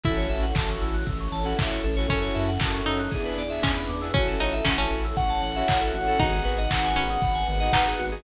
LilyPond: <<
  \new Staff \with { instrumentName = "Lead 2 (sawtooth)" } { \time 4/4 \key gis \phrygian \tempo 4 = 117 r1 | r1 | r2 fis''2 | fis''1 | }
  \new Staff \with { instrumentName = "Harpsichord" } { \time 4/4 \key gis \phrygian e'2 r2 | cis'4. dis'4. cis'4 | cis'8 dis'8 cis'16 cis'4.~ cis'16 r4 | dis'4. cis'4. dis'4 | }
  \new Staff \with { instrumentName = "Lead 2 (sawtooth)" } { \time 4/4 \key gis \phrygian <cis' e' fis' a'>4 <cis' e' fis' a'>4.~ <cis' e' fis' a'>16 <cis' e' fis' a'>4 <cis' e' fis' a'>16 | <cis' e' fis' a'>4 <cis' e' fis' a'>4 <b d' e' gis'>8. <b d' e' gis'>4 <b d' e' gis'>16 | <cis' e' fis' a'>4 <cis' e' fis' a'>4.~ <cis' e' fis' a'>16 <cis' e' fis' a'>4 <cis' e' fis' a'>16 | <b dis' fis' gis'>4 <b dis' fis' gis'>4.~ <b dis' fis' gis'>16 <b dis' fis' gis'>4 <b dis' fis' gis'>16 | }
  \new Staff \with { instrumentName = "Electric Piano 2" } { \time 4/4 \key gis \phrygian a'16 cis''16 e''16 fis''16 a''16 cis'''16 e'''16 fis'''16 e'''16 cis'''16 a''16 fis''16 e''16 cis''16 a'16 cis''16 | a'16 cis''16 e''16 fis''16 a''16 cis'''16 e'''16 fis'''16 gis'16 b'16 d''16 e''16 gis''16 b''16 d'''16 e'''16 | fis'16 a'16 cis''16 e''16 fis''16 a''16 cis'''16 e'''16 cis'''16 a''16 fis''16 e''16 cis''16 a'16 fis'16 a'16 | fis'16 gis'16 b'16 dis''16 fis''16 gis''16 b''16 dis'''16 b''16 gis''16 fis''16 dis''16 b'16 gis'16 fis'16 gis'16 | }
  \new Staff \with { instrumentName = "Synth Bass 1" } { \clef bass \time 4/4 \key gis \phrygian a,,8 a,,8 a,,8 a,,8 a,,8 a,,8 a,,8 a,,8 | fis,8 fis,8 fis,8 fis,8 e,8 e,8 e,8 e,8 | a,,8 a,,8 a,,8 a,,8 a,,8 a,,8 a,,8 a,,8 | gis,,8 gis,,8 gis,,8 gis,,8 gis,,8 gis,,8 gis,,8 gis,,8 | }
  \new Staff \with { instrumentName = "Pad 5 (bowed)" } { \time 4/4 \key gis \phrygian <cis' e' fis' a'>2 <cis' e' a' cis''>2 | <cis' e' fis' a'>4 <cis' e' a' cis''>4 <b d' e' gis'>4 <b d' gis' b'>4 | <cis' e' fis' a'>2 <cis' e' a' cis''>2 | <b dis' fis' gis'>2 <b dis' gis' b'>2 | }
  \new DrumStaff \with { instrumentName = "Drums" } \drummode { \time 4/4 <hh bd>8 hho8 <hc bd>8 hho8 <hh bd>8 hho8 <hc bd>8 hho8 | <hh bd>8 hho8 <hc bd>8 hho8 <hh bd>8 hho8 <hc bd>8 hho8 | <hh bd>8 hho8 <hc bd>8 hho8 <hh bd>8 hho8 <hc bd>8 hho8 | <hh bd>8 hho8 <hc bd>8 hho8 <hh bd>8 hho8 <hc bd>8 hho8 | }
>>